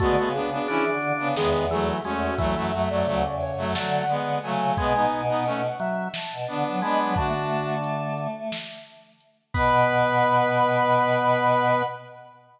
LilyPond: <<
  \new Staff \with { instrumentName = "Ocarina" } { \time 7/8 \key b \dorian \tempo 4 = 88 fis'8 gis'4 r8 gis'8 gis'16 r16 fis'8 | e''8. d''8. cis''8 fis''4 gis''8 | gis''8. fis''8. e''8 a''4 b''8 | a''4. r2 |
b''2.~ b''8 | }
  \new Staff \with { instrumentName = "Brass Section" } { \time 7/8 \key b \dorian <gis b>16 <gis b>16 <b d'>16 <b d'>16 <cis' e'>16 r8 <b d'>16 <gis b>8 <fis a>8 <a cis'>8 | <fis a>16 <fis a>16 <fis a>16 <fis a>16 <fis a>16 r8 <fis a>16 <fis a>8 <gis b>8 <fis a>8 | <gis b>16 <b dis'>8 <b dis'>16 <a cis'>16 r4 r16 <b d'>8 <b d'>8 | <d' fis'>4 r2 r8 |
b'2.~ b'8 | }
  \new Staff \with { instrumentName = "Drawbar Organ" } { \time 7/8 \key b \dorian a8 r8 d'4 dis8 e8 gis8 | e16 e16 r8 cis4 a8 r4 | gis8 r4 fis8 r4 gis8 | d2 r4. |
b2.~ b8 | }
  \new Staff \with { instrumentName = "Choir Aahs" } { \time 7/8 \key b \dorian d16 cis8. \tuplet 3/2 { e8 d8 cis8 } e,4 e,8 | e,16 fis,8. \tuplet 3/2 { d,8 e,8 fis,8 } d4 cis8 | b,8 b,4 r8. b,16 d16 fis16 gis16 fis16 | a16 a2~ a16 r4 |
b,2.~ b,8 | }
  \new DrumStaff \with { instrumentName = "Drums" } \drummode { \time 7/8 <hh bd>8 hh8 hh8 hh8 sn8 hh8 hh8 | <hh bd>8 hh8 hh8 hh8 sn8 hh8 hh8 | <hh bd>8 hh8 hh8 hh8 sn8 hh8 hh8 | <hh bd>8 hh8 hh8 hh8 sn8 hh8 hh8 |
<cymc bd>4 r4 r4. | }
>>